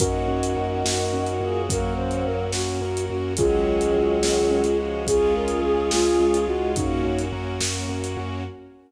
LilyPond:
<<
  \new Staff \with { instrumentName = "Flute" } { \time 6/8 \key ges \lydian \tempo 4. = 71 <ges' bes'>2. | bes'8 c''8 bes'8 ges'4 ges'8 | <f' aes'>2. | aes'8 bes'8 aes'8 f'4 ges'8 |
<ees' ges'>4 r2 | }
  \new Staff \with { instrumentName = "Choir Aahs" } { \time 6/8 \key ges \lydian <ees' ges'>2~ <ees' ges'>8 <f' aes'>8 | <ges bes>4. r4. | <ees ges>2~ <ees ges>8 <f aes>8 | <f' aes'>2~ <f' aes'>8 <ees' ges'>8 |
<bes des'>4 r2 | }
  \new Staff \with { instrumentName = "Acoustic Grand Piano" } { \time 6/8 \key ges \lydian des'8 ges'8 bes'8 ges'8 des'8 ges'8 | bes'8 ges'8 des'8 ges'8 bes'8 ges'8 | des'8 ges'8 aes'8 ges'8 des'8 ges'8 | des'8 f'8 aes'8 f'8 des'8 f'8 |
des'8 ges'8 bes'8 ges'8 des'8 ges'8 | }
  \new Staff \with { instrumentName = "Synth Bass 2" } { \clef bass \time 6/8 \key ges \lydian ges,8 ges,8 ges,8 ges,8 ges,8 ges,8 | ges,8 ges,8 ges,8 ges,8 ges,8 ges,8 | des,8 des,8 des,8 des,8 des,8 des,8 | des,8 des,8 des,8 des,8 des,8 des,8 |
ges,8 ges,8 ges,8 ges,8 ges,8 ges,8 | }
  \new Staff \with { instrumentName = "String Ensemble 1" } { \time 6/8 \key ges \lydian <bes des' ges'>2.~ | <bes des' ges'>2. | <aes des' ges'>2. | <aes des' f'>2. |
<bes des' ges'>2. | }
  \new DrumStaff \with { instrumentName = "Drums" } \drummode { \time 6/8 <hh bd>8. hh8. sn8. hh8. | <hh bd>8. hh8. sn8. hh8. | <hh bd>8. hh8. sn8. hh8. | <hh bd>8. hh8. sn8. hh8. |
<hh bd>8. hh8. sn8. hh8. | }
>>